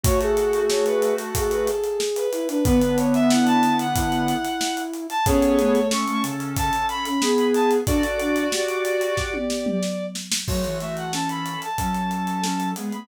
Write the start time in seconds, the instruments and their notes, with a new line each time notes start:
0.04 lead 1 (square) A3 F#4, ocarina F#4, violin C#5, kick, closed hi-hat
0.21 ocarina G#4, violin A4, closed hi-hat
0.37 closed hi-hat
0.53 closed hi-hat
0.70 violin C#5, snare
0.86 violin B4, closed hi-hat
1.02 closed hi-hat
1.18 violin A4, closed hi-hat
1.35 ocarina G#4, violin A4, kick, closed hi-hat
1.51 violin B4, closed hi-hat
1.67 violin A4, closed hi-hat
1.84 closed hi-hat
2.00 snare
2.16 violin B4, closed hi-hat
2.32 ocarina E4, closed hi-hat
2.48 ocarina D4, violin B4, closed hi-hat
2.64 lead 1 (square) D3 B3, ocarina B3, violin B4, kick, closed hi-hat
2.82 closed hi-hat
2.98 violin C#5, closed hi-hat
3.14 violin E5, closed hi-hat
3.30 ocarina E4, violin F#5, snare
3.47 violin A5, closed hi-hat
3.63 closed hi-hat
3.79 violin F#5, closed hi-hat
3.94 ocarina E4, kick, closed hi-hat
4.12 closed hi-hat
4.28 closed hi-hat
4.45 closed hi-hat
4.61 snare
4.77 closed hi-hat
4.93 closed hi-hat
5.10 violin A5, closed hi-hat
5.26 lead 1 (square) B3 G#4, ocarina C#4, violin A4 C#5, kick, closed hi-hat
5.42 closed hi-hat
5.58 ocarina A3, closed hi-hat
5.75 closed hi-hat
5.91 lead 1 (square) C#4 A4, violin C#6, snare
6.08 ocarina A3, closed hi-hat
6.23 ocarina C#3, closed hi-hat
6.40 closed hi-hat
6.57 violin A5, kick, closed hi-hat
6.73 closed hi-hat
6.89 violin B5, closed hi-hat
7.05 ocarina C#4, violin B5, closed hi-hat
7.21 lead 1 (square) B3 G#4, ocarina G#4, snare
7.38 closed hi-hat
7.54 violin A5, closed hi-hat
7.71 closed hi-hat
7.87 ocarina D4, lead 1 (square) F#4 D5, violin A4, kick, closed hi-hat
8.03 closed hi-hat
8.20 ocarina D4, violin F#4, closed hi-hat
8.36 closed hi-hat
8.52 ocarina G4, snare
8.68 closed hi-hat
8.85 closed hi-hat
9.01 closed hi-hat
9.17 violin D5, kick, snare
9.34 high tom
9.50 snare
9.66 mid tom
9.83 snare
10.15 snare
10.32 snare
10.48 ocarina F#3, lead 1 (square) A3 F#4, violin C#5, kick, crash
10.64 ocarina E3, closed hi-hat
10.80 lead 1 (square) A3 F#4, violin E5, closed hi-hat
10.97 violin F#5, closed hi-hat
11.13 lead 1 (square) C#4 A4, violin A5, snare
11.29 violin B5, closed hi-hat
11.46 closed hi-hat
11.62 violin A5, closed hi-hat
11.78 ocarina F#3, lead 1 (square) C#4 A4, kick, closed hi-hat
11.94 closed hi-hat
12.11 closed hi-hat
12.27 closed hi-hat
12.43 lead 1 (square) C#4 A4, snare
12.60 closed hi-hat
12.76 ocarina G#3, lead 1 (square) B3 G#4, closed hi-hat
12.92 ocarina A3, violin B5, closed hi-hat